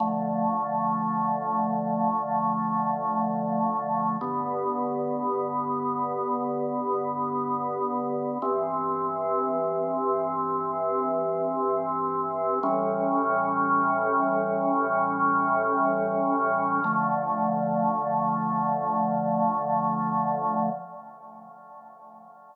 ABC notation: X:1
M:4/4
L:1/8
Q:1/4=57
K:Dm
V:1 name="Drawbar Organ"
[D,F,A,]8 | [G,,D,=B,]8 | [G,,E,C]8 | [A,,E,G,^C]8 |
[D,F,A,]8 |]